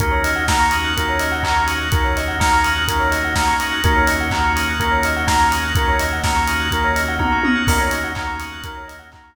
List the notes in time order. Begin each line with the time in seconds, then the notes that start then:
0.00 D#2 A#3 C#4 D#4 F#4 A#4, kick, closed hi-hat
0.11 C#5
0.24 D#5, open hi-hat
0.36 F#5
0.48 A#3 C#4 D#4 F#4 A#5, kick, snare
0.60 C#6
0.71 D#6, open hi-hat
0.84 F#6
0.97 A#3 C#4 D#4 F#4 A#4, kick, closed hi-hat
1.09 C#5
1.20 D#5, open hi-hat
1.32 F#5
1.43 A#3 C#4 D#4 F#4 A#5, kick, clap
1.56 C#6
1.67 D#6, open hi-hat
1.81 F#6
1.92 A#3 C#4 D#4 F#4 A#4, kick, closed hi-hat
2.04 C#5
2.17 D#5, open hi-hat
2.28 F#5
2.40 A#3 C#4 D#4 F#4 A#5, kick, snare
2.53 C#6
2.64 D#6, open hi-hat
2.75 F#6
2.88 A#3 C#4 D#4 F#4 A#4, kick, closed hi-hat
2.99 C#5
3.11 D#5, open hi-hat
3.24 F#5
3.35 A#3 C#4 D#4 F#4 A#5, kick, snare
3.47 C#6
3.60 D#6, open hi-hat
3.72 F#6
3.84 D#2 A#3 C#4 D#4 F#4 A#4, kick, closed hi-hat
3.95 C#5
4.07 D#5, open hi-hat
4.21 F#5
4.31 A#3 C#4 D#4 F#4 A#5, kick, clap
4.44 C#6
4.56 D#6, open hi-hat
4.69 F#6
4.80 A#3 C#4 D#4 F#4 A#4, kick, closed hi-hat
4.91 C#5
5.03 D#5, open hi-hat
5.16 F#5
5.27 A#3 C#4 D#4 F#4 A#5, kick, snare
5.40 C#6
5.51 D#6, open hi-hat
5.64 F#6
5.75 A#3 C#4 D#4 F#4 A#4, kick, closed hi-hat
5.88 C#5
5.99 D#5, open hi-hat
6.12 F#5
6.24 A#3 C#4 D#4 F#4 A#5, kick, snare
6.36 C#6
6.48 D#6, open hi-hat
6.60 F#6
6.71 A#3 C#4 D#4 F#4 A#4, kick, closed hi-hat
6.84 C#5
6.96 D#5, open hi-hat
7.08 F#5
7.19 A#3 C#4 D#4 F#4 A#5, kick, high tom
7.32 C#6
7.44 D#6, high tom
7.55 F#6
7.67 D#2 A#3 C#4 D#4 F#4 A#4, kick, crash
7.81 C#5
7.91 D#5, open hi-hat
8.04 F#5
8.15 A#3 C#4 D#4 F#4 A#5, kick, clap
8.27 C#6
8.40 D#6, open hi-hat
8.52 F#6
8.64 A#3 C#4 D#4 F#4 A#4, kick, closed hi-hat
8.77 C#5
8.88 D#5, open hi-hat
8.99 F#5
9.12 A#3 C#4 D#4 F#4 A#5, kick, clap
9.24 C#6